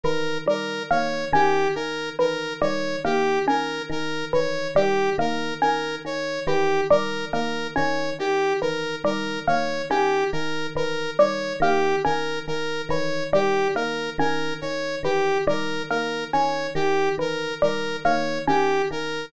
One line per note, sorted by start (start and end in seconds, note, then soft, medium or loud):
0.03 0.38 D#3 medium
0.03 0.39 E3 medium
0.03 0.38 A#4 medium
0.46 0.80 D#3 medium
0.46 0.82 G3 medium
0.46 0.83 A#4 medium
0.91 1.25 D#3 medium
0.91 1.25 A#3 medium
0.91 1.25 C#5 medium
1.33 1.67 D#3 medium
1.33 1.67 C#4 medium
1.33 1.68 G4 medium
1.75 2.11 D#3 medium
1.75 2.09 A#4 medium
2.19 2.53 D#3 medium
2.19 2.53 E3 medium
2.19 2.53 A#4 medium
2.61 2.96 D#3 medium
2.61 2.96 G3 medium
2.61 2.96 C#5 medium
3.04 3.39 D#3 medium
3.04 3.39 A#3 medium
3.04 3.39 G4 medium
3.46 3.81 D#3 medium
3.46 3.82 C#4 medium
3.46 3.82 A#4 medium
3.89 4.24 D#3 medium
3.89 4.25 A#4 medium
4.33 4.68 D#3 medium
4.33 4.67 E3 medium
4.33 4.68 C#5 medium
4.75 5.09 D#3 medium
4.75 5.10 G3 medium
4.75 5.10 G4 medium
5.18 5.52 D#3 medium
5.18 5.53 A#3 medium
5.18 5.54 A#4 medium
5.61 5.98 D#3 medium
5.61 5.96 C#4 medium
5.61 5.96 A#4 medium
6.05 6.39 D#3 medium
6.05 6.40 C#5 medium
6.47 6.81 D#3 medium
6.47 6.82 E3 medium
6.47 6.81 G4 medium
6.90 7.25 D#3 medium
6.90 7.25 G3 medium
6.90 7.25 A#4 medium
7.33 7.67 D#3 medium
7.33 7.67 A#3 medium
7.33 7.67 A#4 medium
7.76 8.12 D#3 medium
7.76 8.10 C#4 medium
7.76 8.10 C#5 medium
8.19 8.54 D#3 medium
8.19 8.53 G4 medium
8.61 8.97 D#3 medium
8.61 8.96 E3 medium
8.61 8.96 A#4 medium
9.04 9.38 D#3 medium
9.04 9.39 G3 medium
9.04 9.39 A#4 medium
9.47 9.82 D#3 medium
9.47 9.82 A#3 medium
9.47 9.82 C#5 medium
9.90 10.24 D#3 medium
9.90 10.25 C#4 medium
9.90 10.24 G4 medium
10.32 10.67 D#3 medium
10.32 10.67 A#4 medium
10.75 11.09 D#3 medium
10.75 11.11 E3 medium
10.75 11.11 A#4 medium
11.19 11.53 D#3 medium
11.19 11.53 G3 medium
11.19 11.53 C#5 medium
11.60 11.94 D#3 medium
11.60 11.96 A#3 medium
11.60 11.96 G4 medium
12.04 12.40 D#3 medium
12.04 12.39 C#4 medium
12.04 12.39 A#4 medium
12.47 12.82 D#3 medium
12.47 12.82 A#4 medium
12.89 13.23 D#3 medium
12.89 13.25 E3 medium
12.89 13.24 C#5 medium
13.33 13.67 D#3 medium
13.33 13.68 G3 medium
13.33 13.68 G4 medium
13.75 14.09 D#3 medium
13.75 14.10 A#3 medium
13.75 14.10 A#4 medium
14.18 14.53 D#3 medium
14.18 14.54 C#4 medium
14.18 14.54 A#4 medium
14.61 14.97 D#3 medium
14.61 14.96 C#5 medium
15.03 15.37 D#3 medium
15.03 15.39 E3 medium
15.03 15.38 G4 medium
15.47 15.81 D#3 medium
15.47 15.82 G3 medium
15.47 15.83 A#4 medium
15.90 16.25 D#3 medium
15.90 16.25 A#3 medium
15.90 16.24 A#4 medium
16.33 16.68 D#3 medium
16.33 16.68 C#4 medium
16.33 16.67 C#5 medium
16.75 17.09 D#3 medium
16.75 17.09 G4 medium
17.18 17.52 D#3 medium
17.18 17.53 E3 medium
17.18 17.54 A#4 medium
17.62 17.97 D#3 medium
17.62 17.96 G3 medium
17.62 17.96 A#4 medium
18.04 18.39 D#3 medium
18.04 18.39 A#3 medium
18.04 18.38 C#5 medium
18.48 18.82 D#3 medium
18.48 18.82 C#4 medium
18.48 18.82 G4 medium
18.91 19.25 D#3 medium
18.91 19.26 A#4 medium